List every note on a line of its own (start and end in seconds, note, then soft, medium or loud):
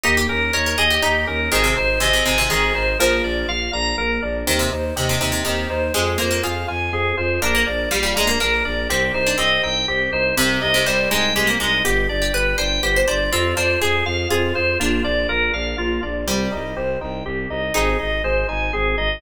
0.03 0.26 D#2 loud
0.03 0.26 A#3 loud
0.03 0.15 D#4 medium
0.03 0.27 G4 medium
0.17 0.29 G4 medium
0.29 0.50 D#2 medium
0.29 0.51 C#4 medium
0.29 0.52 A#4 medium
0.53 0.75 D#2 medium
0.53 0.76 D#4 medium
0.53 0.65 A#4 medium
0.53 0.76 C#5 medium
0.66 0.78 A#4 medium
0.78 0.99 D#2 medium
0.78 1.00 G4 medium
0.78 0.89 G#4 medium
0.78 1.01 D#5 medium
0.90 1.02 G4 medium
1.02 1.25 D#2 medium
1.02 1.43 D#4 medium
1.02 1.25 D#4 loud
1.02 1.25 G4 medium
1.27 1.48 D#2 medium
1.27 1.49 C#4 loud
1.27 1.50 A#4 medium
1.52 1.73 G#1 loud
1.52 1.63 D#3 medium
1.52 1.74 C4 loud
1.52 1.74 G#4 medium
1.64 1.75 C3 medium
1.76 1.98 G#1 medium
1.76 1.99 D#4 medium
1.76 1.99 C5 medium
2.00 2.21 G#1 medium
2.00 2.12 C3 medium
2.00 2.23 G#4 medium
2.00 2.24 D#5 medium
2.13 2.25 C3 medium
2.26 2.47 G#1 medium
2.26 2.37 C3 medium
2.26 2.48 D#4 loud
2.26 2.48 G#5 medium
2.38 2.50 C3 medium
2.50 2.71 G#1 medium
2.50 2.91 D#3 medium
2.50 2.72 C4 medium
2.50 2.73 G#4 medium
2.75 2.96 G#1 medium
2.75 2.97 D#4 medium
2.75 2.97 C5 medium
2.99 3.21 A#1 loud
2.99 3.48 F3 medium
2.99 3.21 A#3 loud
2.99 3.22 A#4 medium
3.23 3.44 A#1 medium
3.23 3.46 D4 medium
3.23 3.47 D5 medium
3.47 3.68 A#1 medium
3.47 3.71 F4 loud
3.47 3.71 F5 medium
3.72 3.93 A#1 medium
3.72 3.95 D4 medium
3.72 3.96 A#5 medium
3.97 4.18 A#1 medium
3.97 4.20 A#3 loud
3.97 4.20 A#4 medium
4.22 4.43 A#1 medium
4.22 4.45 D4 medium
4.22 4.45 D5 medium
4.47 4.68 D#2 loud
4.47 4.59 D#3 medium
4.47 4.69 C4 loud
4.47 4.70 G4 medium
4.59 4.71 C3 medium
4.71 4.92 D#2 medium
4.71 4.94 D#4 medium
4.71 4.94 C5 medium
4.95 5.16 D#2 medium
4.95 5.09 C3 medium
4.95 5.18 G4 medium
4.95 5.19 D#5 medium
5.09 5.20 C3 medium
5.20 5.41 D#2 medium
5.20 5.31 C3 medium
5.20 5.43 D#4 loud
5.20 5.43 G5 medium
5.32 5.44 C3 medium
5.45 5.66 D#2 medium
5.45 5.85 D#3 medium
5.45 5.68 C4 medium
5.45 5.68 G4 medium
5.70 5.90 D#2 medium
5.70 5.92 D#4 loud
5.70 5.93 C5 medium
5.94 6.16 F2 loud
5.94 6.17 G#3 medium
5.94 6.17 C4 loud
5.94 6.17 G#4 medium
6.18 6.40 F2 medium
6.18 6.30 A#3 medium
6.18 6.41 F4 medium
6.18 6.42 C5 medium
6.31 6.42 A#3 medium
6.43 6.65 F2 medium
6.43 7.27 F4 medium
6.43 6.66 G#4 medium
6.43 6.66 F5 medium
6.68 6.90 F2 medium
6.68 6.90 F4 medium
6.68 6.91 G#5 medium
6.91 7.12 F2 medium
6.91 7.15 C4 medium
6.91 7.15 G#4 medium
7.17 7.39 F2 medium
7.17 7.39 F4 medium
7.17 7.40 C5 medium
7.42 7.63 A#1 loud
7.42 7.64 A#3 loud
7.42 7.54 D4 medium
7.42 7.65 A#4 medium
7.55 7.66 A#3 medium
7.66 7.87 A#1 medium
7.66 7.89 D4 medium
7.66 7.89 D5 medium
7.91 8.13 A#1 medium
7.91 8.02 G3 medium
7.91 8.14 F4 medium
7.91 8.14 F5 medium
8.03 8.14 G3 medium
8.16 8.37 A#1 medium
8.16 8.29 G#3 medium
8.16 8.38 D4 medium
8.16 8.38 A#5 medium
8.27 8.39 A#3 medium
8.40 8.62 A#1 medium
8.40 8.62 A#3 medium
8.40 8.86 D4 medium
8.40 8.63 A#4 medium
8.65 8.87 A#1 medium
8.65 8.87 D4 medium
8.65 8.88 D5 medium
8.89 9.10 C2 loud
8.89 9.12 C4 loud
8.89 9.21 C4 medium
8.89 9.12 G4 medium
9.14 9.35 C2 medium
9.14 9.36 D#4 medium
9.14 9.37 C5 medium
9.27 9.38 D4 medium
9.38 9.59 C2 medium
9.38 9.78 C4 medium
9.38 9.61 G4 medium
9.38 9.61 D#5 medium
9.63 9.85 C2 medium
9.63 9.86 D#4 medium
9.63 9.86 G5 medium
9.87 10.08 C2 medium
9.87 10.10 C4 loud
9.87 10.11 G4 medium
10.12 10.32 C2 medium
10.12 10.35 D#4 medium
10.12 10.35 C5 medium
10.36 10.57 C2 loud
10.36 10.69 C3 medium
10.36 10.59 C4 loud
10.36 10.60 G4 medium
10.61 10.83 C2 medium
10.61 10.84 D#4 loud
10.61 10.84 D#5 medium
10.74 10.86 C3 medium
10.86 11.07 C2 medium
10.86 11.09 G3 medium
10.86 11.09 G4 medium
10.86 11.09 C5 medium
11.11 11.33 C2 medium
11.11 11.32 G#3 medium
11.11 11.33 D#4 loud
11.11 11.34 G5 medium
11.35 11.56 C2 medium
11.35 11.47 G#3 medium
11.35 11.58 C4 medium
11.35 11.58 G4 medium
11.47 11.59 A#3 medium
11.60 11.81 C2 loud
11.60 11.80 G#3 medium
11.60 11.82 D#4 medium
11.60 11.83 D#5 medium
11.85 12.06 G1 loud
11.85 12.07 B3 loud
11.85 12.07 G4 medium
11.85 12.17 G4 medium
12.09 12.31 G1 medium
12.09 12.31 D4 medium
12.09 12.32 D5 medium
12.22 12.33 G4 medium
12.33 12.54 G1 medium
12.33 12.56 G4 medium
12.33 12.56 B4 medium
12.58 12.79 G1 medium
12.58 12.80 D4 medium
12.58 12.82 C5 medium
12.58 12.81 G5 medium
12.82 13.03 G1 medium
12.82 13.05 B3 loud
12.82 13.06 G4 medium
12.82 12.95 C5 medium
12.96 13.07 C5 medium
13.07 13.29 G1 medium
13.07 13.30 D4 medium
13.07 13.30 C5 medium
13.07 13.30 D5 medium
13.32 13.53 F2 loud
13.32 13.54 C4 loud
13.32 13.54 C4 medium
13.32 13.55 F4 medium
13.56 13.77 F2 medium
13.56 13.79 D4 medium
13.56 13.79 F4 medium
13.56 13.79 C5 medium
13.81 14.03 F2 medium
13.81 14.03 G#4 loud
13.81 14.04 G#4 medium
13.81 14.14 G#4 medium
14.06 14.26 F2 loud
14.06 14.28 F4 medium
14.06 14.29 F5 medium
14.30 14.52 F2 medium
14.30 14.53 C4 loud
14.30 14.53 F4 medium
14.30 14.78 G#4 medium
14.55 14.76 F2 medium
14.55 14.78 F4 medium
14.55 14.78 C5 medium
14.80 15.01 A#1 loud
14.80 15.02 A#3 loud
14.80 15.52 D4 medium
14.80 15.02 F4 medium
15.04 15.26 A#1 medium
15.04 15.26 D4 loud
15.04 15.27 D5 medium
15.29 15.50 A#1 medium
15.29 15.51 F4 loud
15.29 15.52 A#4 medium
15.53 15.74 A#1 medium
15.53 15.76 D4 medium
15.53 15.76 F5 medium
15.78 15.98 A#1 medium
15.78 16.00 A#3 loud
15.78 16.01 F4 medium
16.03 16.24 A#1 medium
16.03 16.25 D4 medium
16.03 16.25 D5 medium
16.27 16.48 C2 loud
16.27 17.14 G3 medium
16.27 16.49 C4 loud
16.27 16.50 G4 medium
16.52 16.74 C2 medium
16.52 16.74 D#4 loud
16.52 16.74 D#5 medium
16.76 16.97 C2 medium
16.76 16.99 G4 loud
16.76 16.99 C5 medium
17.01 17.22 C2 medium
17.01 17.23 D#4 loud
17.01 17.24 G5 medium
17.25 17.46 C2 loud
17.25 17.48 C4 medium
17.25 17.48 G4 medium
17.49 17.70 C2 medium
17.49 17.72 D#4 medium
17.49 17.73 D#5 medium
17.74 17.95 G#1 loud
17.74 17.97 C4 loud
17.74 18.20 D#4 medium
17.74 17.97 G#4 medium
17.99 18.21 G#1 medium
17.99 18.21 D#4 medium
17.99 18.22 D#5 medium
18.23 18.44 G#1 medium
18.23 18.46 G#4 medium
18.23 18.47 C5 medium
18.49 18.70 G#1 medium
18.49 18.71 D#4 medium
18.49 18.71 G#5 medium
18.73 18.95 G#1 medium
18.73 18.95 C4 medium
18.73 18.96 G#4 medium
18.98 19.19 G#1 medium
18.98 19.20 D#4 medium
18.98 19.20 D#5 medium